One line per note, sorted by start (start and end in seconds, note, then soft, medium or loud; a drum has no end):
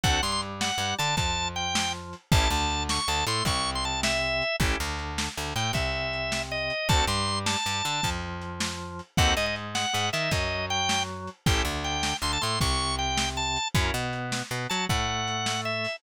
0.03 0.20 D2 loud
0.03 0.21 C4 medium
0.03 0.21 D4 loud
0.03 0.21 F#4 medium
0.03 0.21 A4 medium
0.03 0.22 F#5 medium
0.03 kick medium
0.03 closed hi-hat medium
0.22 0.72 G2 medium
0.22 0.71 G3 medium
0.22 0.31 C6 medium
0.32 0.41 C6 medium
0.42 closed hi-hat medium
0.61 0.95 F#5 medium
0.61 snare medium
0.78 0.94 G2 medium
0.78 0.96 G3 medium
0.98 1.16 D3 loud
0.98 1.15 D4 medium
0.98 1.16 A5 medium
0.98 closed hi-hat medium
1.17 2.14 F2 medium
1.17 2.15 F3 medium
1.17 1.48 A5 medium
1.17 kick medium
1.17 closed hi-hat medium
1.56 1.92 G5 medium
1.56 closed hi-hat medium
1.75 snare loud
2.13 closed hi-hat medium
2.32 2.48 A1 loud
2.32 2.49 C#4 medium
2.32 2.49 E4 medium
2.32 2.49 G4 medium
2.32 2.49 A4 medium
2.32 2.50 A5 medium
2.32 kick loud
2.32 closed hi-hat medium
2.50 2.99 D2 loud
2.50 3.00 D3 medium
2.50 2.83 A5 medium
2.70 closed hi-hat medium
2.89 3.08 C#6 medium
2.89 snare medium
3.08 3.24 D2 medium
3.08 3.24 D3 medium
3.08 3.25 A5 medium
3.27 3.43 A2 loud
3.27 3.44 A3 medium
3.27 3.44 C6 medium
3.27 closed hi-hat medium
3.45 4.42 C2 medium
3.45 4.43 C3 medium
3.45 3.70 C#6 medium
3.45 kick medium
3.45 closed hi-hat medium
3.75 3.84 C6 medium
3.84 4.01 A5 medium
3.84 closed hi-hat medium
4.03 4.56 E5 medium
4.03 snare loud
4.42 closed hi-hat medium
4.60 4.76 A1 loud
4.60 4.78 C#4 medium
4.60 4.78 E4 medium
4.60 4.78 G4 loud
4.60 4.78 A4 medium
4.60 kick medium
4.60 closed hi-hat medium
4.80 5.29 D2 medium
4.80 5.29 D3 medium
4.99 closed hi-hat medium
5.18 snare medium
5.37 5.54 D2 medium
5.37 5.53 D3 medium
5.55 5.72 A2 medium
5.55 5.72 A3 medium
5.55 5.72 G5 medium
5.55 closed hi-hat medium
5.73 6.70 C2 medium
5.73 6.72 C3 medium
5.73 6.42 E5 medium
5.73 kick medium
5.73 closed hi-hat medium
6.13 closed hi-hat soft
6.32 snare medium
6.52 6.88 D#5 medium
6.70 closed hi-hat medium
6.89 7.05 D2 loud
6.89 7.06 C4 medium
6.89 7.06 D4 medium
6.89 7.06 F#4 medium
6.89 7.06 A4 medium
6.89 7.05 A5 medium
6.89 kick medium
6.89 closed hi-hat medium
7.07 7.56 G2 loud
7.07 7.57 G3 medium
7.07 7.39 C6 medium
7.27 closed hi-hat medium
7.46 8.10 A5 medium
7.46 snare medium
7.66 7.82 G2 medium
7.66 7.82 G3 medium
7.84 8.01 D3 medium
7.84 8.01 D4 medium
7.84 closed hi-hat medium
8.03 9.01 F2 medium
8.03 9.01 F3 medium
8.03 kick medium
8.03 closed hi-hat medium
8.41 closed hi-hat medium
8.60 snare medium
8.99 closed hi-hat medium
9.17 9.34 D#2 loud
9.17 9.35 C4 medium
9.17 9.35 D#4 medium
9.17 9.35 F#4 medium
9.17 9.35 A4 medium
9.17 9.34 F#5 medium
9.17 kick medium
9.17 closed hi-hat medium
9.37 9.85 G#2 medium
9.37 9.86 G#3 medium
9.37 9.46 D#5 medium
9.46 9.55 D#5 medium
9.56 closed hi-hat medium
9.75 10.09 F#5 medium
9.75 snare medium
9.93 10.10 G#2 loud
9.93 10.09 G#3 medium
10.13 10.30 D#3 medium
10.13 10.30 D#4 medium
10.13 10.31 E5 medium
10.13 closed hi-hat medium
10.31 11.28 F#2 loud
10.31 11.30 F#3 medium
10.31 10.66 D#5 medium
10.31 kick medium
10.31 closed hi-hat medium
10.70 11.03 G5 medium
10.70 closed hi-hat medium
10.89 snare medium
11.27 closed hi-hat medium
11.46 11.63 A1 loud
11.46 11.64 C#4 medium
11.46 11.64 E4 medium
11.46 11.64 G4 loud
11.46 11.64 A4 medium
11.46 11.62 G5 medium
11.46 kick medium
11.46 closed hi-hat loud
11.65 12.13 D2 loud
11.65 12.14 D3 medium
11.84 12.17 G5 medium
11.84 closed hi-hat medium
12.03 snare medium
12.22 12.38 D2 medium
12.22 12.39 D3 medium
12.22 12.32 C6 medium
12.33 12.42 A5 medium
12.41 12.59 A2 medium
12.41 12.58 A3 medium
12.41 12.59 C6 medium
12.41 closed hi-hat medium
12.60 13.58 C2 loud
12.60 13.58 C3 medium
12.60 12.95 C#6 medium
12.60 kick medium
12.60 closed hi-hat medium
12.99 13.29 G5 medium
12.99 closed hi-hat medium
13.17 snare medium
13.37 13.68 A5 medium
13.56 closed hi-hat medium
13.75 13.91 F#2 loud
13.75 13.92 C#4 medium
13.75 13.92 E4 medium
13.75 13.92 F#4 medium
13.75 13.92 A#4 medium
13.75 kick medium
13.75 closed hi-hat medium
13.94 14.43 B2 loud
13.94 14.42 B3 loud
14.13 closed hi-hat medium
14.32 snare medium
14.51 14.67 B2 medium
14.51 14.67 B3 medium
14.70 14.87 F#3 medium
14.70 14.86 F#4 medium
14.70 14.85 A5 medium
14.70 closed hi-hat medium
14.89 15.87 A2 loud
14.89 15.86 A3 medium
14.89 15.61 F#5 medium
14.89 kick medium
14.89 closed hi-hat medium
15.27 closed hi-hat medium
15.46 snare medium
15.65 15.96 E5 medium
15.84 open hi-hat medium